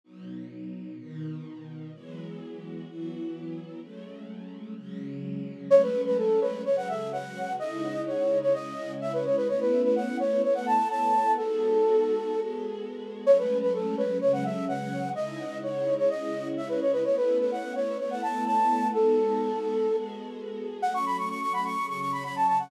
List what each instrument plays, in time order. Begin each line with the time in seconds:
0.04 string ensemble 1 B2 F#3 D#4
0.98 string ensemble 1 B2 D#3 D#4
1.93 string ensemble 1 E3 F#3 G#3 B3
2.87 string ensemble 1 E3 F#3 B3 E4
3.81 string ensemble 1 F#3 G#3 A3 C#4
4.76 string ensemble 1 C#3 F#3 G#3 C#4
5.70 string ensemble 1 F#3 G#3 A3 C#4, flute C#5
5.82 flute B4
6.06 flute B4
6.18 flute A4
6.41 flute B4
6.65 string ensemble 1 C#3 F#3 G#3 C#4, flute C#5
6.77 flute F#5
6.89 flute E5
7.12 flute F#5
7.59 string ensemble 1 C#3 G#3 D#4 E4, flute D#5
8.07 flute C#5
8.42 flute C#5
8.53 string ensemble 1 C#3 G#3 C#4 E4, flute D#5
9.01 flute E5
9.13 flute B4
9.25 flute C#5
9.37 flute B4
9.48 string ensemble 1 A3 B3 C#4 E4, flute C#5
9.60 flute B4
9.84 flute B4
9.96 flute F#5
10.19 flute C#5
10.43 string ensemble 1 A3 B3 E4 A4, flute C#5
10.55 flute F#5
10.66 flute A5
10.90 flute A5
11.37 string ensemble 1 G#3 B3 D#4 F#4, flute A4
12.32 string ensemble 1 G#3 B3 F#4 G#4
13.25 string ensemble 1 F#3 G#3 A3 C#4, flute C#5
13.38 flute B4
13.62 flute B4
13.74 flute A4
13.97 flute B4
14.21 string ensemble 1 C#3 F#3 G#3 C#4, flute C#5
14.33 flute F#5
14.45 flute E5
14.68 flute F#5
15.15 string ensemble 1 C#3 G#3 D#4 E4, flute D#5
15.63 flute C#5
15.98 flute C#5
16.10 string ensemble 1 C#3 G#3 C#4 E4, flute D#5
16.57 flute E5
16.69 flute B4
16.81 flute C#5
16.93 flute B4
17.04 string ensemble 1 A3 B3 C#4 E4, flute C#5
17.16 flute B4
17.40 flute B4
17.52 flute F#5
17.75 flute C#5
17.99 string ensemble 1 A3 B3 E4 A4, flute C#5
18.11 flute F#5
18.23 flute A5
18.46 flute A5
18.93 string ensemble 1 G#3 B3 D#4 F#4, flute A4
19.88 string ensemble 1 G#3 B3 F#4 G#4
20.82 string ensemble 1 F#3 A3 C#4, flute F#5
20.94 flute C#6
21.06 flute B5
21.18 flute C#6
21.29 flute C#6
21.41 flute C#6
21.53 flute B5
21.65 flute C#6
21.77 string ensemble 1 C#3 F#3 C#4
21.88 flute C#6
22.00 flute C#6
22.12 flute B5
22.24 flute B5
22.36 flute A5
22.48 flute A5
22.59 flute F#5